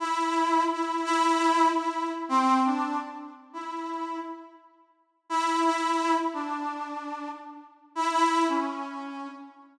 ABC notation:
X:1
M:6/8
L:1/8
Q:3/8=113
K:none
V:1 name="Brass Section"
E4 E2 | E4 E2 | z C2 D2 z | z2 E4 |
z6 | E2 E3 z | D6 | z3 E E2 |
_D5 z |]